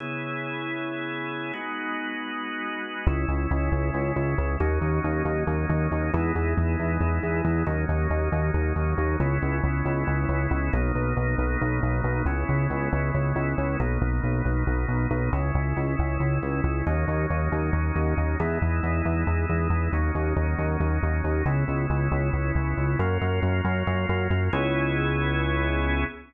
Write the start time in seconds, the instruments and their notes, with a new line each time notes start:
0.00 drawbar organ C#3 B3 E4 G#4
1.53 drawbar organ G#3 B3 D#4 F#4
3.06 synth bass 1 C#2, drawbar organ G#3 C#4 E4
3.28 synth bass 1 C#2
3.51 synth bass 1 C#2
3.72 synth bass 1 C#2
3.94 synth bass 1 C#2
4.16 synth bass 1 C#2
4.38 synth bass 1 C#2
4.60 synth bass 1 D#2, drawbar organ F#3 A#3 C#4 D#4
4.81 synth bass 1 D#2
5.04 synth bass 1 D#2
5.25 synth bass 1 D#2
5.47 synth bass 1 D#2
5.69 synth bass 1 D#2
5.92 synth bass 1 D#2
6.13 synth bass 1 E2, drawbar organ G#3 B3 D#4 E4
6.35 synth bass 1 E2
6.57 synth bass 1 E2
6.79 synth bass 1 E2
7.01 synth bass 1 E2
7.23 synth bass 1 E2
7.45 synth bass 1 E2
7.66 synth bass 1 D#2, drawbar organ F#3 A#3 C#4 D#4
7.89 synth bass 1 D#2
8.10 synth bass 1 D#2
8.32 synth bass 1 D#2
8.54 synth bass 1 D#2
8.76 synth bass 1 D#2
8.98 synth bass 1 D#2
9.20 synth bass 1 C#2, drawbar organ G#3 B3 C#4 E4
9.42 synth bass 1 C#2
9.64 synth bass 1 C#2
9.85 synth bass 1 C#2
10.07 synth bass 1 C#2
10.29 synth bass 1 C#2
10.51 synth bass 1 C#2
10.73 synth bass 1 B1, drawbar organ F#3 A#3 B3 D#4
10.95 synth bass 1 B1
11.17 synth bass 1 B1
11.38 synth bass 1 B1
11.61 synth bass 1 B1
11.83 synth bass 1 B1
12.04 synth bass 1 B1
12.26 synth bass 1 C#2, drawbar organ G#3 B3 C#4 E4
12.49 synth bass 1 C#2
12.70 synth bass 1 C#2
12.93 synth bass 1 C#2
13.14 synth bass 1 C#2
13.36 synth bass 1 C#2
13.58 synth bass 1 C#2
13.80 synth bass 1 B1, drawbar organ F#3 A#3 B3 D#4
14.02 synth bass 1 B1
14.23 synth bass 1 B1
14.45 synth bass 1 B1
14.67 synth bass 1 B1
14.88 synth bass 1 B1
15.11 synth bass 1 B1
15.33 synth bass 1 C#2, drawbar organ G#3 C#4 E4
15.55 synth bass 1 C#2
15.77 synth bass 1 C#2
15.99 synth bass 1 C#2
16.20 synth bass 1 C#2
16.42 synth bass 1 C#2
16.64 synth bass 1 C#2
16.86 synth bass 1 D#2, drawbar organ F#3 A#3 C#4 D#4
17.08 synth bass 1 D#2
17.30 synth bass 1 D#2
17.52 synth bass 1 D#2
17.73 synth bass 1 D#2
17.96 synth bass 1 D#2
18.17 synth bass 1 D#2
18.40 synth bass 1 E2, drawbar organ G#3 B3 D#4 E4
18.62 synth bass 1 E2
18.83 synth bass 1 E2
19.05 synth bass 1 E2
19.27 synth bass 1 E2
19.49 synth bass 1 E2
19.70 synth bass 1 E2
19.93 synth bass 1 D#2, drawbar organ F#3 A#3 C#4 D#4
20.15 synth bass 1 D#2
20.36 synth bass 1 D#2
20.58 synth bass 1 D#2
20.80 synth bass 1 D#2
21.03 synth bass 1 D#2
21.24 synth bass 1 D#2
21.46 synth bass 1 C#2, drawbar organ G#3 B3 C#4 E4
21.68 synth bass 1 C#2
21.90 synth bass 1 C#2
22.12 synth bass 1 C#2
22.33 synth bass 1 C#2
22.55 synth bass 1 C#2
22.77 synth bass 1 C#2
22.99 synth bass 1 F#2, drawbar organ F#3 A#3 C#4 F4
23.21 synth bass 1 F#2
23.43 synth bass 1 F#2
23.65 synth bass 1 F#2
23.87 synth bass 1 F#2
24.09 synth bass 1 F#2
24.30 synth bass 1 F#2
24.53 synth bass 1 C#2, drawbar organ B3 C#4 E4 G#4